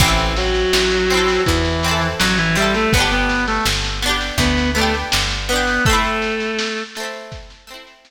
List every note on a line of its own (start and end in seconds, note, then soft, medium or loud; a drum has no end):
0.00 0.66 A1 loud
0.00 0.32 E3 medium
0.00 1.02 C4 medium
0.00 0.32 E4 loud
0.00 kick loud
0.00 snare medium
0.04 1.02 E4 medium
0.04 1.02 A4 medium
0.18 snare medium
0.37 1.41 F#3 medium
0.37 1.41 F#4 medium
0.37 snare medium
0.55 snare medium
0.73 1.39 A1 medium
0.73 snare loud
0.91 snare medium
1.10 1.78 C4 medium
1.10 snare medium
1.14 1.78 E4 medium
1.14 1.78 A4 medium
1.28 snare medium
1.46 2.14 E2 medium
1.46 2.06 E3 medium
1.46 2.06 E4 loud
1.46 kick medium
1.46 snare medium
1.65 snare medium
1.83 2.52 C4 medium
1.83 snare medium
1.88 2.52 E4 medium
1.88 2.52 A4 medium
2.01 snare medium
2.19 2.86 A1 medium
2.19 2.37 F#3 loud
2.19 2.37 F#4 loud
2.19 snare loud
2.38 2.55 E3 loud
2.38 2.55 E4 loud
2.38 snare medium
2.55 2.73 G3 loud
2.55 2.89 C4 medium
2.55 2.89 E4 medium
2.55 2.73 G4 loud
2.55 snare medium
2.62 2.89 A4 medium
2.74 2.92 A3 medium
2.74 2.92 A4 loud
2.74 snare medium
2.93 3.59 G1 medium
2.93 3.10 B3 loud
2.93 3.95 B3 medium
2.93 3.10 B4 loud
2.93 kick loud
2.93 snare medium
2.97 3.95 D4 medium
2.97 3.95 G4 medium
3.11 3.44 B3 medium
3.11 3.44 B4 loud
3.11 snare medium
3.29 snare medium
3.47 3.65 A3 medium
3.47 3.65 A4 loud
3.47 snare medium
3.66 4.31 G1 medium
3.66 snare medium
3.84 snare medium
4.02 4.70 B3 medium
4.02 4.70 D4 medium
4.02 snare medium
4.09 4.70 G4 medium
4.21 snare medium
4.38 5.04 D2 medium
4.38 4.70 B3 medium
4.38 4.70 B4 loud
4.38 kick medium
4.38 snare medium
4.57 snare medium
4.75 4.93 A3 medium
4.75 5.42 B3 medium
4.75 5.42 D4 medium
4.75 4.93 A4 loud
4.75 snare medium
4.82 5.42 G4 medium
4.94 snare medium
5.12 5.79 G1 medium
5.12 snare loud
5.30 snare medium
5.49 5.83 B3 medium
5.49 5.83 D4 medium
5.49 5.83 B4 medium
5.49 snare medium
5.56 5.83 G4 medium
5.67 snare medium
5.85 6.80 A3 loud
5.85 6.87 A3 medium
5.85 6.80 A4 loud
5.85 kick loud
5.85 snare medium
5.89 6.87 C4 medium
5.89 6.87 E4 medium
6.04 snare medium
6.22 snare medium
6.40 snare medium
6.59 snare loud
6.77 snare medium
6.95 7.64 A3 medium
6.95 snare medium
7.00 7.64 C4 medium
7.00 7.64 E4 medium
7.14 snare medium
7.32 kick medium
7.32 snare medium
7.50 snare medium
7.67 8.11 A3 medium
7.67 8.11 C4 medium
7.67 snare medium
7.74 8.11 E4 medium
7.87 snare medium
8.05 snare medium